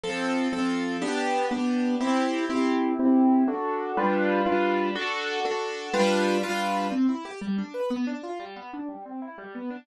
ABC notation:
X:1
M:6/8
L:1/8
Q:3/8=122
K:C
V:1 name="Acoustic Grand Piano"
[F,CA]3 [F,CA]3 | [B,DG]3 [B,DG]3 | [CEG]3 [CEG]3 | [CEG]3 [D^FA]3 |
[G,DFB]3 [G,DFB]3 | [D^FA]3 [DFA]3 | [G,DFB]3 [G,DFB]3 | C E G G, D B |
B, D F G, B, D | G, C E G, B, D |]